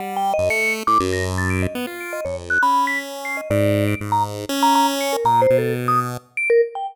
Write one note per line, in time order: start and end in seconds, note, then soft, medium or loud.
0.00 0.33 G3 medium
0.00 0.15 F#5 medium
0.16 0.31 G5 loud
0.34 0.49 D#5 loud
0.38 0.50 F#2 medium
0.49 0.83 A3 medium
0.49 0.73 C#7 loud
0.87 0.98 A2 medium
0.87 0.98 D6 loud
1.00 1.67 F#2 loud
1.13 1.24 A#6 medium
1.38 1.49 A6 medium
1.50 1.61 D7 medium
1.62 1.74 D#5 soft
1.75 1.86 B3 loud
1.87 2.21 F4 medium
2.00 2.12 D7 medium
2.13 2.24 D#5 medium
2.25 2.59 F2 medium
2.25 2.36 C#5 medium
2.50 2.61 F#6 medium
2.62 3.41 C#4 medium
2.62 2.85 B5 medium
2.87 2.98 B6 medium
3.25 3.36 C7 medium
3.37 3.48 D#5 soft
3.50 3.95 G#2 loud
3.50 3.84 D5 medium
3.88 3.99 D7 medium
4.01 4.46 G#2 medium
4.12 4.23 A#5 loud
4.49 5.17 C#4 loud
4.63 4.74 A#5 loud
4.75 4.87 A#5 loud
5.01 5.12 C#7 medium
5.13 5.24 A#4 medium
5.24 5.47 A#2 medium
5.24 5.40 A#5 loud
5.42 5.57 C5 medium
5.50 6.17 B2 medium
5.58 5.73 A4 medium
5.88 5.99 D#6 medium
6.37 6.48 D7 loud
6.50 6.61 A#4 loud
6.75 6.86 G5 medium